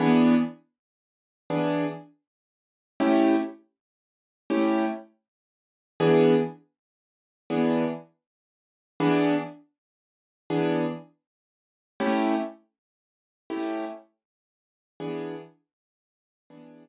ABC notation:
X:1
M:12/8
L:1/8
Q:3/8=80
K:E
V:1 name="Acoustic Grand Piano"
[E,B,=DG]6 [E,B,DG]6 | [A,CE=G]6 [A,CEG]6 | [E,B,=DG]6 [E,B,DG]6 | [E,B,=DG]6 [E,B,DG]6 |
[A,CE=G]6 [A,CEG]6 | [E,B,=DG]6 [E,B,DG]6 |]